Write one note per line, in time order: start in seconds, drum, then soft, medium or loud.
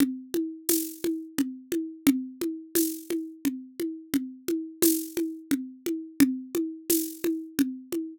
0.00 low conga loud
0.34 high conga medium
0.69 tambourine medium
0.69 high conga medium
1.04 high conga medium
1.38 low conga medium
1.72 high conga medium
2.07 low conga loud
2.41 high conga medium
2.75 tambourine medium
2.75 high conga medium
3.10 high conga medium
3.45 low conga medium
3.80 high conga medium
4.14 low conga medium
4.48 high conga medium
4.82 tambourine medium
4.82 high conga loud
5.17 high conga medium
5.51 low conga medium
5.86 high conga medium
6.20 low conga loud
6.55 high conga medium
6.90 tambourine medium
6.90 high conga medium
7.24 high conga medium
7.59 low conga loud
7.92 high conga medium